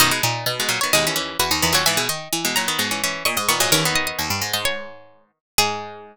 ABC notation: X:1
M:4/4
L:1/16
Q:1/4=129
K:G#m
V:1 name="Harpsichord"
d6 z c d4 B3 c | g6 a z5 c'2 c'2 | c12 z4 | G16 |]
V:2 name="Harpsichord"
D2 D4 z6 F D2 F | e2 d4 z6 d d2 d | A z d d z3 d c6 z2 | G16 |]
V:3 name="Harpsichord"
[F,,D,] [B,,G,] z3 [B,,G,] [A,,F,] [D,B,] [B,,G,] [E,C] [E,C]2 z2 [D,B,] [A,,F,] | [G,,E,] [B,,G,] z3 [B,,G,] [A,,F,] [D,B,] [B,,G,] [E,C] [E,C]2 z2 [D,B,] [A,,F,] | [E,C] [D,B,]15 | G,16 |]
V:4 name="Harpsichord" clef=bass
B,,2 A,,2 B,,4 D,,4 E,, D,, E,, D,, | E,2 D,2 E,4 G,,4 A,, G,, A,, G,, | D,,4 D,, =G,, ^G,, G,,7 z2 | G,,16 |]